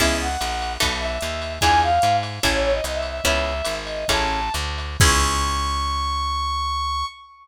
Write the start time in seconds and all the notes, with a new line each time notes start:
0.00 C#2 B3 C#4 E4 G#4 E5, kick, crash, ride
0.22 F#5
0.41 A#1, hi-hat pedal, ride
0.62 ride
0.80 B1 B3 D#4 F#4 A4, kick, ride
1.00 E5
1.21 D#2, hi-hat pedal, ride
1.42 ride
1.61 E2 D4 E4 F4 G#4 G#5, kick, ride
1.82 F5
2.02 G#2, hi-hat pedal, ride
2.23 ride
2.43 A1 C#4 E4 G#4 A4, kick, ride
2.53 C#5
2.63 C#5
2.73 D#5
2.84 C2 D#5, hi-hat pedal, ride
2.95 E5
3.02 ride
3.09 E5
3.24 C#2 B3 C#4 E4 G#4 E5, kick, ride
3.65 G#1, hi-hat pedal, ride
3.85 D#5, ride
4.08 A1 C#4 E4 G#4 A4 A5, kick, ride
4.54 D2, hi-hat pedal, ride
4.78 ride
5.00 C#2 B3 C#4 E4 G#4 C#6, kick, crash